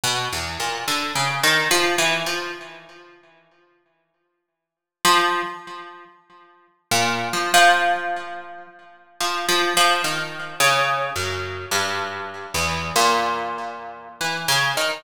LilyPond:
\new Staff { \clef bass \time 3/4 \tempo 4 = 72 \tuplet 3/2 { b,8 e,8 ais,8 d8 cis8 dis8 f8 e8 f8 } | r2. | f8 r4. r16 ais,8 f16 | f4. r8 \tuplet 3/2 { f8 f8 f8 } |
\tuplet 3/2 { dis4 cis4 fis,4 } g,4 | e,8 ais,4. \tuplet 3/2 { e8 cis8 dis8 } | }